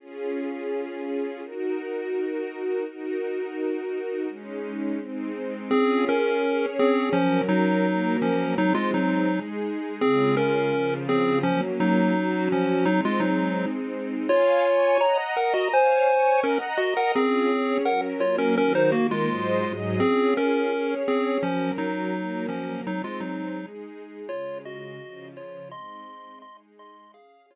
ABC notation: X:1
M:4/4
L:1/8
Q:1/4=168
K:Db
V:1 name="Lead 1 (square)"
z8 | z8 | z8 | z8 |
[CA]2 [DB]4 [CA]2 | [F,D]2 [G,E]4 [F,D]2 | [G,E] [A,F] [G,E]3 z3 | [CA]2 [DB]4 [CA]2 |
[F,D] z [G,E]4 [F,D]2 | [G,E] [A,F] [G,E]3 z3 | [Fd]4 [db] z [Bg] [Ge] | [ca]4 [DB] z [Ge] [Bg] |
[CA]4 [Bg] z [Fd] [DB] | [DB] [Ec] [B,G] [A,F]4 z | [CA]2 [DB]4 [CA]2 | [F,D]2 [G,E]4 [F,D]2 |
[G,E] [A,F] [G,E]3 z3 | [Fd]2 [Ge]4 [Fd]2 | [ec']4 [ec'] z [ec']2 | [Af]2 [Fd]4 z2 |]
V:2 name="String Ensemble 1"
[DFA]8 | [EGB]8 | [EGB]8 | [A,DE]4 [A,CE]4 |
[DFA]4 [DAd]4 | [G,DB]4 [G,B,B]4 | [A,CE]4 [A,EA]4 | [D,A,F]4 [D,F,F]4 |
[G,B,D]4 [G,DG]4 | [A,CE]8 | [dfa]2 [dad']2 [egb]2 [Beb]2 | [dfa]2 [dad']2 [egb]2 [Beb]2 |
[DFA]2 [DAd]2 [G,DB]2 [G,B,B]2 | [E,G,B]2 [E,B,B]2 [A,,G,ce]2 [A,,G,Ae]2 | [DFA]4 [DAd]4 | [G,DB]4 [G,B,B]4 |
[A,CE]4 [A,EA]4 | [D,A,F]4 [D,F,F]4 | [A,CE]4 [A,EA]4 | [DAf]4 z4 |]